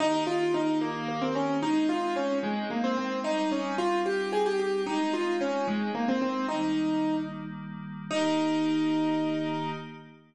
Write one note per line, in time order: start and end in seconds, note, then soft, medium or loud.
0.00 1.61 D#3 medium
0.00 1.61 A#3 medium
0.00 0.23 D#4 loud
0.00 1.61 G4 medium
0.27 0.53 F4 medium
0.54 0.79 D#4 medium
0.81 1.08 A#3 medium
1.08 1.21 A#3 medium
1.22 1.34 C4 medium
1.35 1.59 C#4 medium
1.62 3.23 G#3 medium
1.62 3.23 C4 medium
1.62 3.23 D#4 medium
1.62 1.88 D#4 medium
1.89 2.14 F4 medium
2.16 2.38 C#4 medium
2.43 2.69 G#3 medium
2.70 2.83 A#3 medium
2.84 2.97 C4 medium
2.97 3.19 C4 medium
3.24 4.85 G3 medium
3.24 4.85 C4 medium
3.24 4.85 D#4 medium
3.24 3.50 D#4 medium
3.52 3.75 C#4 medium
3.78 4.01 F4 medium
4.06 4.31 G4 medium
4.32 4.45 G#4 medium
4.46 4.59 G4 medium
4.59 4.82 G4 medium
4.86 6.47 G#3 medium
4.86 6.47 C4 medium
4.86 6.47 D#4 medium
4.86 5.13 D#4 medium
5.13 5.36 F4 medium
5.41 5.66 C#4 medium
5.68 5.91 G#3 medium
5.95 6.07 A#3 medium
6.08 6.21 C4 medium
6.22 6.46 C4 medium
6.48 8.09 D#3 medium
6.48 8.09 G3 medium
6.48 8.09 A#3 medium
6.48 7.16 D#4 medium
8.11 9.70 D#3 loud
8.11 9.70 A#3 loud
8.11 9.70 D#4 loud
8.11 9.70 G4 loud